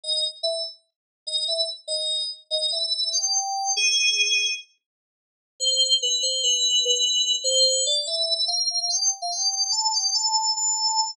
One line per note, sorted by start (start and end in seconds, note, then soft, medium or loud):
0.04 0.23 D#5 medium
0.43 0.62 E5 medium
1.27 1.43 D#5 medium
1.48 1.66 E5 medium
1.88 2.23 D#5 loud
2.51 2.71 D#5 medium
2.72 3.10 E5 medium
3.12 3.70 G5 medium
3.77 4.50 G#4 medium
5.60 5.94 C5 medium
6.02 6.22 B4 medium
6.23 6.41 C5 medium
6.43 6.83 B4 medium
6.85 7.35 B4 medium
7.44 7.84 C5 loud
7.86 8.05 D5 medium
8.07 8.46 E5 medium
8.48 8.67 F5 medium
8.71 8.80 F5 medium
8.80 8.90 F5 medium
8.90 9.00 G5 medium
9.00 9.10 G5 medium
9.22 9.31 F5 medium
9.32 9.71 G5 medium
9.72 9.91 A5 medium
9.93 10.13 G5 medium
10.14 10.53 A5 medium
10.57 11.11 A5 loud